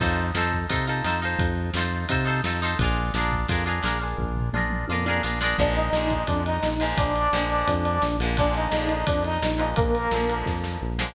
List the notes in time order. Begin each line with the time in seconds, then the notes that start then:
0.00 F2 D#4 F4 A4 C5, kick, crash
0.35 F2 D#4 F4 A4 C5, snare
0.52 kick
0.69 C3 D#4 F4 A4 C5, kick, ride
0.87 D#4 F4 A4 C5
1.04 F2 D#4 F4 A4 C5, snare
1.22 D#4 F4 A4 C5
1.39 F2, kick, ride
1.74 F2 D#4 F4, snare
1.78 A4 C5
2.09 C3 D#4 F4 A4 C5, kick, ride
2.25 D#4 F4 A4 C5
2.44 F2 D#4 F4 A4 C5, snare
2.62 D#4 F4 A4 C5
2.79 A#1 D4 F4 G#4, kick, ride
2.84 A#4
3.14 A#1 D4 F4 G#4 A#4, snare
3.32 kick
3.48 F2 D4 F4 G#4 A#4, kick, ride
3.66 D4 F4 G#4 A#4
3.82 A#1 D4 F4 G#4 A#4, snare
4.01 D4 F4 G#4 A#4
4.18 A#1, kick, floor tom
4.37 floor tom
4.53 A#1 D4 F4 G#4 A#4, mid tom
4.70 mid tom
4.88 F2 D4 F4 G#4, high tom
4.93 A#4
5.06 D4 F4 G#4 A#4, high tom
5.23 A#1 D4 F4 G#4 A#4
5.41 D4 F4 G#4 A#4, snare
5.58 A#1 D3 F3 G#3 A#3 D4 D5, kick, crash
5.75 D#4 D#5, ride
5.93 A#1 D3 F3 G#3, snare
5.97 A#3
6.10 kick, ride
6.27 F2 D4 D5, kick, ride
6.46 D#4 D#5, ride
6.63 A#1, snare
6.80 D3 F3 G#3 A#3, ride
6.98 A#1 D4 D5, kick, ride
7.16 ride
7.33 A#1 D3 F3 G#3 A#3, snare
7.50 ride
7.68 F2, kick, ride
7.85 ride
8.02 A#1, snare
8.19 A#1 D3 F3 G#3, ride
8.24 A#3
8.37 D3 F3 G#3 A#3 D4 D5, kick, ride
8.54 D#4 D#5, ride
8.71 A#1 D3 F3 G#3 A#3, snare
8.89 ride
9.07 F2 D4 D5, kick, ride
9.24 D#4 D#5, ride
9.42 A#1, snare
9.58 D3 F3 G#3 A#3, ride
9.76 A#1 A#3 A#4, kick, ride
9.95 ride
10.11 A#1 D3 F3 G#3 A#3, snare
10.29 ride
10.46 F2, kick, snare
10.64 snare
10.82 A#1
10.99 D3 F3 G#3 A#3, snare